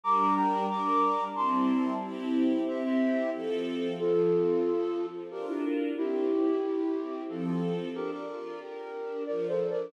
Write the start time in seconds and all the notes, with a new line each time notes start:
0.04 G3 D4 A#4 A#5 D6
0.36 G5 A#5
0.70 G3 D4 A#4 A#5 D6
1.35 G3 C4 E4 A5 C6
2.02 C4 E4 G4
2.67 C4 E4 G4 C5 E5
2.84 C5 E5
3.33 F3 C4 A4
3.99 F3 F4 A4
4.33 C4
4.65 A4
4.98 F3
5.31 D4 F4 G4 A#4
5.48 E4 G4
5.97 C4 E4 G4
6.30 E4
6.63 G4
6.96 C4
7.29 F3 C4 F4 A4
7.45 F4 A4
7.95 D4 G4 A#4
8.12 A#4 D5
8.28 F4
8.61 G4 A#4
8.94 D4
9.27 F3 A#4 D5
9.49 A4 C5
9.60 D4
9.71 A#4 D5